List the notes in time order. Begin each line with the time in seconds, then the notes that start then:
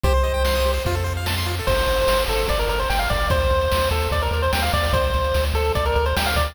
0.04 C2 G4 C5, kick, closed hi-hat
0.14 C5
0.23 D#5, closed hi-hat
0.34 G5
0.45 C6, snare
0.55 D#6
0.65 G4, closed hi-hat
0.74 C5
0.85 F2 F4, kick, closed hi-hat
0.95 A4
1.04 C5, closed hi-hat
1.17 F5
1.26 A5, snare
1.37 C6
1.46 F4, closed hi-hat
1.59 A4
1.67 G1 C5, kick, crash
1.78 closed hi-hat
1.87 G1, closed hi-hat
1.97 closed hi-hat
2.08 G1, snare
2.19 closed hi-hat
2.28 G1 A4, closed hi-hat
2.39 closed hi-hat
2.48 G1 D5, kick, closed hi-hat
2.59 A#4, closed hi-hat
2.69 G1 A#4, closed hi-hat
2.79 C5, closed hi-hat
2.89 G1 G5, snare
2.99 F5, closed hi-hat
3.10 G1 D5, kick, closed hi-hat
3.20 closed hi-hat
3.30 D#2 C5, kick, closed hi-hat
3.41 closed hi-hat
3.51 D#2, closed hi-hat
3.61 closed hi-hat
3.72 D#2, snare
3.81 closed hi-hat
3.91 D#2 A4, closed hi-hat
4.02 closed hi-hat
4.11 D#2 D5, kick, closed hi-hat
4.22 A#4, closed hi-hat
4.31 D#2 A#4, closed hi-hat
4.42 C5, closed hi-hat
4.53 D#2 G5, snare
4.63 F5, closed hi-hat
4.73 D#2 D5, kick, closed hi-hat
4.83 open hi-hat
4.93 D2 C5, kick, closed hi-hat
5.04 closed hi-hat
5.14 D2, closed hi-hat
5.24 closed hi-hat
5.34 D2, snare
5.45 closed hi-hat
5.54 D2 A4, closed hi-hat
5.65 closed hi-hat
5.75 D2 D5, kick, closed hi-hat
5.86 A#4, closed hi-hat
5.95 D2 A#4, closed hi-hat
6.06 C5, closed hi-hat
6.17 D2 G5, snare
6.26 F5, closed hi-hat
6.36 D2 D5, kick, closed hi-hat
6.47 closed hi-hat